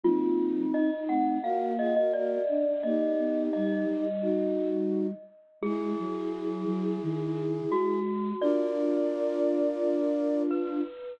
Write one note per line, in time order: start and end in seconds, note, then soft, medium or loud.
0.03 0.65 F#3 medium
0.03 0.65 A#3 medium
0.03 0.90 C4 medium
0.03 0.90 D#4 medium
0.03 0.61 F4 loud
0.73 1.37 D#4 medium
0.73 1.05 D#5 medium
1.08 1.39 A3 medium
1.08 1.39 C4 medium
1.08 1.37 F#5 medium
1.42 2.36 A#3 medium
1.42 1.73 F#4 medium
1.42 1.73 A#4 medium
1.42 1.73 F5 medium
1.78 1.94 F4 medium
1.78 1.94 G#4 medium
1.78 1.95 D#5 medium
1.96 2.12 F#4 medium
1.96 2.12 A#4 medium
1.96 2.13 D#5 loud
2.13 2.42 F#4 medium
2.13 2.42 A#4 medium
2.13 2.81 D5 loud
2.48 2.65 D4 medium
2.67 2.84 D4 medium
2.83 3.12 A#3 medium
2.83 4.05 D#4 medium
2.83 4.05 G4 medium
2.83 3.44 D#5 medium
3.18 3.49 B3 medium
3.53 3.85 G3 medium
3.53 4.68 D#5 medium
3.86 5.12 G3 medium
4.21 5.07 D#4 medium
4.21 5.07 F#4 medium
5.61 5.93 G#3 loud
5.61 7.99 E4 medium
5.61 7.42 G#4 loud
5.61 7.99 G#4 medium
5.99 6.65 F#3 medium
6.65 6.97 F#3 medium
7.02 7.61 D#3 medium
7.70 8.33 G#3 medium
7.70 8.30 F#4 loud
8.41 10.81 D4 medium
8.41 10.81 F4 loud
8.41 10.43 A#4 medium
8.41 10.43 D5 medium
8.41 10.17 D5 loud
10.51 11.14 B4 loud